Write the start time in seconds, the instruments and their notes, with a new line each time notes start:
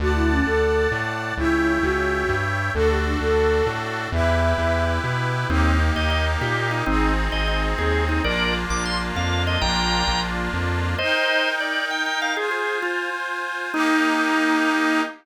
0.00 synth bass 1 D2, flute F#4, accordion D5 F#5 A5
0.15 flute E4
0.31 flute C#4
0.46 synth bass 1 D2, flute A4
0.92 synth bass 1 A2
1.37 synth bass 1 C#2, flute E4, accordion C#5 E5 G5
1.83 synth bass 1 C#2, flute F#4
2.29 synth bass 1 G2
2.74 synth bass 1 D2, accordion D4 F#4 A4, flute A4
2.90 flute G4
3.06 flute D4
3.21 synth bass 1 D2, flute A4
3.66 synth bass 1 A2
4.12 synth bass 1 E2, accordion E4 G4 B4, flute E5
4.58 synth bass 1 E2
5.04 synth bass 1 B2
5.49 synth bass 1 D#2, accordion A#3 D#4 G4, drawbar organ C4 D#4
5.95 synth bass 1 D#2, drawbar organ D#5
6.10 drawbar organ D#5
6.41 synth bass 1 A#2, drawbar organ G4
6.71 drawbar organ D#4
6.86 synth bass 1 G#1, drawbar organ C4 D#4, accordion C4 D#4 G#4
7.32 synth bass 1 G#1, drawbar organ D#5
7.48 drawbar organ D#5
7.78 synth bass 1 D#2, drawbar organ G#4
8.09 drawbar organ D#4
8.24 synth bass 1 A#1, accordion A#3 D4 F4, drawbar organ A#4 D5
8.70 synth bass 1 A#1, drawbar organ D6
8.85 drawbar organ C6
9.16 synth bass 1 F2, drawbar organ F5
9.47 drawbar organ D#5
9.61 synth bass 1 A#1, accordion A#3 D4 F4, drawbar organ G5 A#5
10.08 synth bass 1 A#1
10.54 synth bass 1 F2
10.98 accordion D#4 A#4 G5, drawbar organ C5 D#5
11.60 drawbar organ D5
11.91 drawbar organ G5
12.06 drawbar organ G5
12.22 drawbar organ F5
12.37 accordion F4 C5 G#5, drawbar organ G#4
12.51 drawbar organ G#4
12.82 drawbar organ F4
13.73 accordion A#3 D#4 G4, drawbar organ D#4